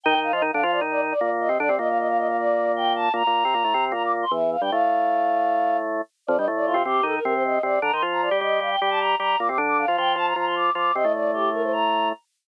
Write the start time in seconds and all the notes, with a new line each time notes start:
0.03 D#3 D#4 G5
0.15 D#3 D#4
0.23 F5
0.33 F3 F4 D#5
0.42 D#3 D#4
0.52 D3 D4 F5
0.62 F3 F4 F5
0.72 D5
0.81 D#3 D#4
0.91 D5
1.11 D5
1.20 A#2 A#3 D5
1.40 D#5
1.49 C3 C4
1.59 D3 D4 D5
1.69 C3 C4
1.79 A#2 A#3 D#5
1.89 F5
1.98 D#5
2.08 F5
2.18 D#5
2.28 F5
2.37 D5
2.76 G5
2.96 A5
3.14 A#2 A#3 A#5
3.27 A#2 A#3
3.45 C3 C4
3.54 A#2 A#3
3.64 A2 A3
3.74 C3 C4
3.92 A#2 A#3 A#5
4.03 D6
4.22 C6
4.31 E2 E3 E5
4.52 F5
4.61 G2 G3 G5
4.71 A2 A3 F5
6.27 F2 F3 D5
6.37 G2 G3 D#5
6.48 A2 A3
6.56 D5
6.66 F4
6.74 C3 C4
6.85 C3 C4 G4
7.03 D#3 D#4 A4
7.15 A#4
7.24 C3 C4 A#4
7.34 C5
7.44 D#5
7.63 C3 C4 D5
7.82 D3 D4 A#5
7.92 D#3 D#4 C6
8.02 F3 F4
8.12 A#5
8.22 D5
8.31 G3 G4
8.41 G3 G4 D#5
8.60 G3 G4 F5
8.70 G5
8.80 G3 G4 G5
8.90 A5
9.00 A#5
9.19 G3 G4 A#5
9.39 A#2 A#3 D6
9.48 C3 C4 D6
9.58 D3 D4
9.68 D6
9.78 F5
9.88 F3 F4
9.97 F3 F4 G5
10.16 F3 F4 A5
10.26 A#5
10.36 F3 F4 A#5
10.46 C6
10.55 D6
10.75 F3 F4 D6
10.94 C3 C4 D#5
11.04 A2 A3
11.14 D5
11.33 G4
11.53 A#4
11.63 C5
11.72 A#5